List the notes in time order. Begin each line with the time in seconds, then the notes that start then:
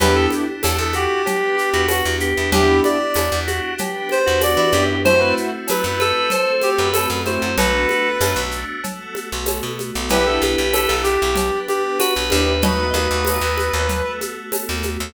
0.00 E2 B3 D4 E4 G4 B4, cowbell, low conga, shaker
0.15 A4
0.30 high conga, shaker
0.63 E2 A4, tambourine, cowbell, high conga, shaker
0.78 E2 A4
0.93 F#4 G4, high conga, shaker
1.26 B3 D4 G4 B4, cowbell, low conga, shaker
1.56 G4, shaker
1.74 E2 F#4
1.88 F#4, tambourine, cowbell, high conga, shaker
2.05 E2
2.20 G4, shaker
2.37 E2
2.52 E2 B3 D4 E4 G4, cowbell, low conga, shaker
2.84 D5, high conga, shaker
3.14 E2, tambourine, cowbell, high conga, shaker
3.32 E2
3.47 F#4, high conga, shaker
3.78 B3 D4 G4 B4, cowbell, low conga, shaker
4.09 C5, high conga, shaker
4.26 E2 F#4
4.41 D5, tambourine, cowbell, high conga, shaker
4.57 E3 D5
4.73 F#2 B3 D4 E4 G4, high conga, shaker
5.05 A3 C4 E4 F#4 C5, cowbell, low conga, shaker
5.19 B4
5.37 shaker
5.68 F#3 B4, tambourine, cowbell, high conga, shaker
5.84 F#2 B4
6.00 A4 B4, high conga, shaker
6.30 A3 C4 F#4 A4 C5, cowbell, low conga, shaker
6.61 G4, high conga, shaker
6.78 F#2 B4
6.93 A4, tambourine, cowbell, high conga, shaker
7.10 F#2
7.26 A3 C4 E4 F#4 C5, high conga, shaker
7.42 F#2
7.58 B1 A3 B3 D4 F#4 A4 B4, cowbell, low conga, shaker
7.89 high conga, shaker
8.20 F#2, tambourine, cowbell, high conga, shaker
8.36 B1
8.51 shaker
8.84 A3 B3 F#4 A4, cowbell, low conga, shaker
9.15 high conga, shaker
9.32 B1
9.46 tambourine, cowbell, high conga, shaker
9.63 B2
9.79 high conga, shaker
9.95 B1
10.09 B1 B3 D4 E4 G4 B4, cowbell, low conga, shaker
10.26 A4
10.42 B1, high conga, shaker
10.58 B1
10.73 A4, tambourine, cowbell, high conga, shaker
10.87 B1 A4
11.03 G4, high conga, shaker
11.22 B1
11.36 B3 D4 G4 B4, cowbell, low conga, shaker
11.68 G4, high conga, shaker
11.99 F#4 B4, tambourine, cowbell, high conga, shaker
12.16 B1
12.30 D#2 B3 D4 E4 G4, high conga, shaker
12.62 A3 B3 D#4 F#4 B4 D#5, cowbell, low conga, shaker
12.94 D#2 A3 B3 D#4 F#4 D#5, high conga, shaker
13.11 D#2
13.25 tambourine, cowbell, high conga, shaker
13.41 D#2
13.58 high conga, shaker
13.73 D#2
13.89 A3 B3 F#4 A4, cowbell, low conga, shaker
14.21 high conga, shaker
14.52 tambourine, cowbell, high conga, shaker
14.69 D#2
14.83 high conga, shaker
15.00 D#2